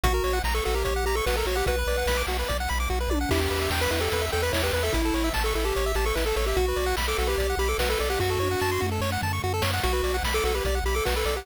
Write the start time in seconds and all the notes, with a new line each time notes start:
0.03 A#1 F#4, kick, closed hi-hat
0.14 A#4
0.24 A#1 C#5, open hi-hat
0.33 F#5
0.44 A#1 A#5, kick, snare
0.54 A4 C#6
0.65 A#1 F#4 A4, open hi-hat
0.74 G4 A#4
0.85 A#1 C#5, kick, closed hi-hat
0.96 F#5
1.04 A#1 G4 A#5, open hi-hat
1.15 A4 C#6
1.26 A#1 F#4 B4, kick, snare
1.37 A4 A#4
1.45 A#1 F#4 C#5, open hi-hat
1.55 G4 F#5
1.66 B1 F#4 B4, kick, closed hi-hat
1.79 B4
1.87 B1 D5, open hi-hat
1.98 F#5
2.06 B1 B5, kick, snare
2.17 D6
2.27 B1 F#4, open hi-hat
2.39 B4
2.48 B1 D5, kick, closed hi-hat
2.60 F#5
2.68 B1 B5, open hi-hat
2.80 D6
2.89 B1 F#4, kick
3.00 B4
3.09 B1 D5, high tom
3.21 F#5
3.29 E2 E4 G4, kick, crash
3.40 G4
3.50 E2 B4, open hi-hat
3.61 E5
3.70 E2 G5, kick, snare
3.81 B4 B5
3.91 E2 E4 B4, open hi-hat
4.01 G4 A4
4.12 E2 B4, kick, closed hi-hat
4.22 E5
4.32 E2 A4 G5, open hi-hat
4.42 B4 B5
4.53 E2 E4 C#5, kick, snare
4.63 G4 B4
4.73 E2 B4, open hi-hat
4.83 A4 E5
4.92 A1 E4, kick, closed hi-hat
5.05 A4
5.14 A1 C#5, open hi-hat
5.24 E5
5.33 A1 A5, kick, snare
5.44 A4 C#6
5.55 A1 E4 A4, open hi-hat
5.65 G4 A4
5.75 A1 C#5, kick, closed hi-hat
5.86 E5
5.95 A1 G4 A5, open hi-hat
6.05 A4 C#6
6.15 A1 E4 B4, kick, snare
6.26 A4
6.36 A1 A4 C#5, open hi-hat
6.46 G4 E5
6.56 B1 F#4, kick, closed hi-hat
6.68 B4
6.76 B1 D5, open hi-hat
6.86 F#5
6.97 B1 B5, kick, snare
7.08 A4 D6
7.18 B1 F#4 A4, open hi-hat
7.27 G4 B4
7.38 B1 D5, kick, closed hi-hat
7.49 F#5
7.57 B1 G4 B5, open hi-hat
7.68 A4 D6
7.78 B1 F#4 B4, kick, snare
7.90 A4 B4
7.98 B1 A4 D5, open hi-hat
8.10 G4 F#5
8.19 F#2 F#4, kick, snare
8.30 A4
8.39 F#2 C#5, high tom
8.51 F#5
8.60 F#2 A5, snare
8.72 C6
8.80 F#2 F#4, mid tom
8.92 A4
9.01 F#2 C#5, snare
9.12 F#5
9.21 F#2 A5, floor tom
9.33 C#6
9.44 F#2 F#4
9.54 A4
9.62 F#2 C#5, snare
9.73 F#5
9.83 B1 F#4, kick, closed hi-hat
9.93 B4
10.03 B1 D5, open hi-hat
10.14 F#5
10.23 B1 B5, kick, snare
10.34 A4 D6
10.44 B1 F#4 A4, open hi-hat
10.55 G4 B4
10.65 B1 D5, kick, closed hi-hat
10.75 F#5
10.84 B1 G4 B5, open hi-hat
10.95 A4 D6
11.05 B1 F#4 B4, kick, snare
11.16 A4 B4
11.25 B1 A4 D5, open hi-hat
11.36 G4 F#5